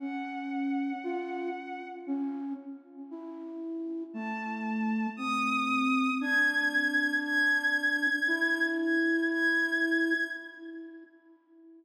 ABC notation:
X:1
M:5/4
L:1/8
Q:1/4=58
K:none
V:1 name="Violin"
_g4 z4 a2 | _e'2 _a'2 a'3 a' a'2 |]
V:2 name="Flute"
_D2 F z D z E2 A,2 | C2 D4 E4 |]